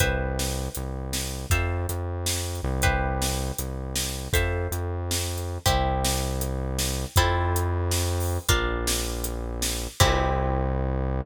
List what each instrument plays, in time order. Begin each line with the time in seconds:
0.00 synth bass 1 C2, acoustic guitar (steel) B4 C5 E5 G5, kick, closed hi-hat
0.39 snare
0.75 synth bass 1 C2, closed hi-hat
1.13 snare
1.50 synth bass 1 F2, acoustic guitar (steel) A4 C5 E5 F5, kick, closed hi-hat
1.89 synth bass 1 F2, closed hi-hat
2.26 snare
2.55 closed hi-hat
2.63 synth bass 1 C2
2.82 acoustic guitar (steel) G4 B4 C5 E5, kick, closed hi-hat
3.22 snare
3.58 synth bass 1 C2, closed hi-hat
3.96 snare
4.33 synth bass 1 F2, acoustic guitar (steel) A4 C5 E5 F5, kick, closed hi-hat
4.71 synth bass 1 F2, closed hi-hat
5.11 snare
5.38 closed hi-hat
5.66 synth bass 1 C2, acoustic guitar (steel) C4 E4 G4, kick, closed hi-hat
6.05 snare
6.41 closed hi-hat
6.79 snare
7.16 synth bass 1 F2, acoustic guitar (steel) C4 E4 F4 A4, kick, closed hi-hat
7.56 closed hi-hat
7.91 snare
8.20 open hi-hat
8.49 synth bass 1 A#1, acoustic guitar (steel) D4 F4 A#4, kick, closed hi-hat
8.87 snare
9.24 closed hi-hat
9.62 snare
10.00 synth bass 1 C2, acoustic guitar (steel) C4 E4 G4, kick, crash